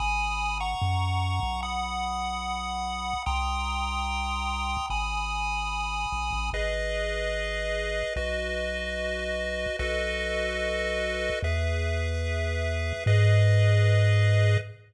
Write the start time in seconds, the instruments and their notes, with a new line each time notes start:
0.00 synth bass 1 G#1, lead 1 (square) G#5 B5 D#6
0.60 lead 1 (square) F#5 A#5 C#6
0.82 synth bass 1 F#2
1.43 synth bass 1 B1
1.63 lead 1 (square) F#5 B5 D#6
3.26 synth bass 1 C2, lead 1 (square) G5 A#5 C6 D#6
4.90 synth bass 1 G#1, lead 1 (square) G#5 B5 D#6
6.12 synth bass 1 A#1
6.33 synth bass 1 A1
6.53 synth bass 1 G#1, lead 1 (square) G#4 B4 D#5
8.16 synth bass 1 B1, lead 1 (square) F#4 B4 D#5
9.79 synth bass 1 B1, lead 1 (square) F#4 A4 B4 D#5
11.43 synth bass 1 E2, lead 1 (square) G#4 B4 E5
13.06 synth bass 1 G#2, lead 1 (square) G#4 B4 D#5